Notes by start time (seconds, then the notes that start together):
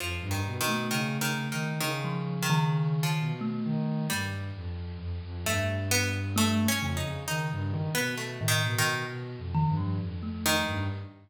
0.00 F2 F3
0.21 G2
0.31 D#3
0.47 B2
0.61 D#3
0.68 A3
0.90 C#3 D#3
1.20 C#3 D#3
1.52 D#3
1.80 C#3 D#3
2.04 F3
2.42 D#3
2.50 D#3
3.03 F3
3.20 B2
3.41 A3
3.65 D#3
4.10 G2 G3
4.55 F2
4.99 F2
5.23 F2
5.43 G2 A3
5.91 B3
6.36 A3
6.59 A3
6.68 C#4
6.81 F2 C#3
6.97 D#4
7.04 C#3
7.28 D#3 D#4
7.52 G2
7.70 D#3
7.95 B2 B3
8.17 A3
8.40 A2 D#3
8.48 D#3
8.64 B2
8.78 D#3
9.08 B2
9.38 F2
9.55 D#3
9.69 G2
9.77 F3
10.01 F2
10.23 A3
10.46 D#3
10.67 G2